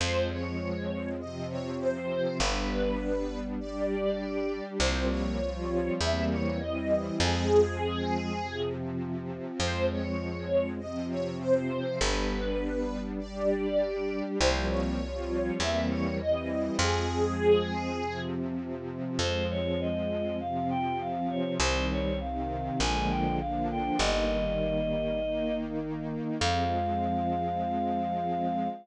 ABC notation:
X:1
M:2/2
L:1/8
Q:1/2=50
K:Fm
V:1 name="String Ensemble 1"
c d3 e d c2 | =B4 =d4 | c d3 =e d _e2 | A5 z3 |
c d3 e d c2 | =B4 =d4 | c d3 =e d _e2 | A5 z3 |
z8 | z8 | z8 | z8 |]
V:2 name="Choir Aahs"
z8 | z8 | z8 | z8 |
z8 | z8 | z8 | z8 |
c d e2 f g f d | c d f2 a g f g | e6 z2 | f8 |]
V:3 name="String Ensemble 1"
[F,A,C]4 [C,F,C]4 | [G,=B,=D]4 [G,DG]4 | [F,G,B,C]2 [F,G,CF]2 [=E,G,B,C]2 [E,G,C=E]2 | [F,A,C]4 [C,F,C]4 |
[F,A,C]4 [C,F,C]4 | [G,=B,=D]4 [G,DG]4 | [F,G,B,C]2 [F,G,CF]2 [=E,G,B,C]2 [E,G,C=E]2 | [F,A,C]4 [C,F,C]4 |
[F,A,C]4 [C,F,C]4 | [E,G,C]2 [C,E,C]2 [=D,F,A,B,]2 [D,F,B,=D]2 | [E,G,B,]4 [E,B,E]4 | [F,A,C]8 |]
V:4 name="Electric Bass (finger)" clef=bass
F,,8 | G,,,8 | C,,4 =E,,4 | F,,8 |
F,,8 | G,,,8 | C,,4 =E,,4 | F,,8 |
F,,8 | C,,4 B,,,4 | G,,,8 | F,,8 |]